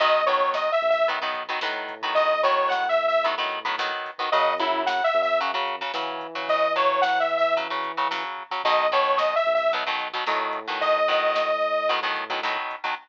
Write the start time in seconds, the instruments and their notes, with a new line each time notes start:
0.00 synth bass 1 B1, overdriven guitar D#3 F#3 B3, lead 2 (sawtooth) D#5, kick, closed hi-hat
0.15 kick
0.26 overdriven guitar D#3 F#3 B3, lead 2 (sawtooth) C#5, kick, closed hi-hat
0.41 kick
0.54 lead 2 (sawtooth) D#5, kick, snare
0.69 lead 2 (sawtooth) E5, kick
0.81 synth bass 1 B1, kick, closed hi-hat
0.90 lead 2 (sawtooth) E5
0.95 kick
1.08 overdriven guitar D#3 F#3 B3, kick, closed hi-hat
1.22 overdriven guitar D#3 F#3 B3, kick
1.34 kick, closed hi-hat
1.48 overdriven guitar D#3 F#3 B3, kick
1.61 synth bass 1 A2, overdriven guitar D#3 F#3 B3, kick, snare
1.75 kick
1.88 kick, closed hi-hat
2.02 overdriven guitar D#3 F#3 B3, kick
2.15 lead 2 (sawtooth) D#5, kick, closed hi-hat
2.30 kick
2.43 overdriven guitar D#3 F#3 B3, lead 2 (sawtooth) C#5, kick, closed hi-hat
2.56 kick
2.68 lead 2 (sawtooth) F#5, kick, snare
2.83 kick
2.89 lead 2 (sawtooth) E5
2.98 kick
3.08 lead 2 (sawtooth) E5, kick
3.24 overdriven guitar D#3 F#3 B3, kick, closed hi-hat
3.38 overdriven guitar D#3 F#3 B3, kick
3.51 kick, closed hi-hat
3.64 overdriven guitar D#3 F#3 B3, kick
3.78 overdriven guitar D#3 F#3 B3, kick, snare
3.92 kick
4.06 kick, closed hi-hat
4.18 overdriven guitar D#3 F#3 B3, kick
4.32 synth bass 1 F#2, overdriven guitar C#3 F#3, lead 2 (sawtooth) D#5, kick, closed hi-hat
4.46 kick
4.58 overdriven guitar C#3 F#3, lead 2 (sawtooth) E4, kick, closed hi-hat
4.73 kick
4.86 lead 2 (sawtooth) F#5, kick, snare
4.99 kick
5.04 lead 2 (sawtooth) E5
5.14 synth bass 1 F#2, kick, closed hi-hat
5.22 lead 2 (sawtooth) E5
5.28 kick
5.39 overdriven guitar C#3 F#3, kick, closed hi-hat
5.54 overdriven guitar C#3 F#3, kick
5.67 kick, closed hi-hat
5.81 overdriven guitar C#3 F#3, kick
5.94 overdriven guitar C#3 F#3, synth bass 1 E3, kick, snare
6.09 kick
6.21 kick, closed hi-hat
6.35 overdriven guitar C#3 F#3, kick
6.49 lead 2 (sawtooth) D#5, kick, closed hi-hat
6.61 kick
6.76 overdriven guitar C#3 F#3, lead 2 (sawtooth) C#5, kick, closed hi-hat
6.90 kick
7.02 lead 2 (sawtooth) F#5, kick, snare
7.16 lead 2 (sawtooth) E5, kick
7.29 kick, closed hi-hat
7.37 lead 2 (sawtooth) E5
7.44 kick
7.57 overdriven guitar C#3 F#3, kick, closed hi-hat
7.70 overdriven guitar C#3 F#3, kick
7.84 kick, closed hi-hat
7.97 overdriven guitar C#3 F#3, kick
8.11 overdriven guitar C#3 F#3, kick, snare
8.24 kick
8.38 kick
8.51 overdriven guitar C#3 F#3, kick
8.64 synth bass 1 B1, overdriven guitar B2 D#3 F#3, lead 2 (sawtooth) D#5, kick, closed hi-hat
8.78 kick
8.92 overdriven guitar B2 D#3 F#3, lead 2 (sawtooth) C#5, kick, closed hi-hat
9.06 kick
9.18 lead 2 (sawtooth) D#5, kick, snare
9.31 kick
9.36 lead 2 (sawtooth) E5
9.45 synth bass 1 B1, kick, closed hi-hat
9.55 lead 2 (sawtooth) E5
9.59 kick
9.72 overdriven guitar B2 D#3 F#3, kick, closed hi-hat
9.86 overdriven guitar B2 D#3 F#3, kick
9.99 kick, closed hi-hat
10.14 overdriven guitar B2 D#3 F#3, kick
10.26 synth bass 1 A2, overdriven guitar B2 D#3 F#3, kick, snare
10.40 kick
10.53 kick, closed hi-hat
10.66 overdriven guitar B2 D#3 F#3, kick
10.81 lead 2 (sawtooth) D#5, kick, closed hi-hat
10.94 kick
11.08 overdriven guitar B2 D#3 F#3, kick, closed hi-hat
11.23 kick
11.35 kick, snare
11.49 kick
11.61 kick, closed hi-hat
11.75 kick
11.89 overdriven guitar B2 D#3 F#3, kick, closed hi-hat
12.02 overdriven guitar B2 D#3 F#3, kick
12.15 kick, closed hi-hat
12.30 overdriven guitar B2 D#3 F#3, kick
12.43 overdriven guitar B2 D#3 F#3, kick, snare
12.57 kick
12.70 kick, closed hi-hat
12.84 overdriven guitar B2 D#3 F#3, kick